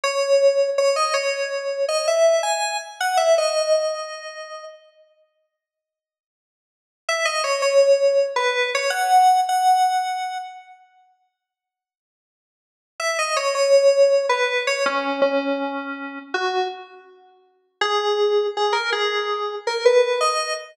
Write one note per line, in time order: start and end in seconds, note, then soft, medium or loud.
0.04 0.70 C#5 medium
0.78 0.96 C#5 medium
0.96 1.14 D#5 medium
1.14 1.85 C#5 medium
1.89 2.06 D#5 medium
2.08 2.42 E5 medium
2.43 2.77 G#5 medium
3.00 3.18 F#5 medium
3.17 3.35 E5 medium
3.38 4.65 D#5 medium
7.09 7.26 E5 medium
7.25 7.43 D#5 medium
7.44 7.61 C#5 medium
7.62 8.26 C#5 medium
8.36 8.70 B4 medium
8.75 8.92 C#5 medium
8.90 9.40 F#5 loud
9.49 10.38 F#5 medium
13.00 13.17 E5 loud
13.19 13.36 D#5 medium
13.37 13.54 C#5 medium
13.55 14.26 C#5 loud
14.29 14.63 B4 medium
14.67 14.85 C#5 medium
14.86 15.21 C#4 loud
15.22 16.19 C#4 medium
16.34 16.67 F#4 medium
17.81 18.47 G#4 loud
18.57 18.74 G#4 medium
18.73 18.90 A#4 medium
18.92 19.55 G#4 medium
19.67 19.85 A#4 medium
19.85 20.19 B4 medium
20.21 20.53 D#5 medium